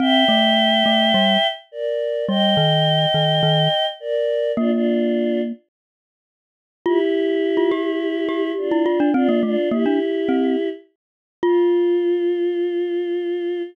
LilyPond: <<
  \new Staff \with { instrumentName = "Choir Aahs" } { \time 4/4 \key f \major \tempo 4 = 105 <e'' g''>2. <bes' d''>4 | <ees'' g''>2. <bes' d''>4 | <d' f'>16 <d' f'>4~ <d' f'>16 r2 r8 | <e' g'>2. <d' f'>4 |
<d' f'>8 <d' f'>8 <e' g'>2 r4 | f'1 | }
  \new Staff \with { instrumentName = "Glockenspiel" } { \time 4/4 \key f \major c'8 a4 a8 g8 r4. | g8 ees4 ees8 ees8 r4. | bes2 r2 | f'16 r4 f'16 g'4 g'8. e'16 f'16 d'16 |
c'16 bes16 a16 r16 bes16 d'16 r8 c'8 r4. | f'1 | }
>>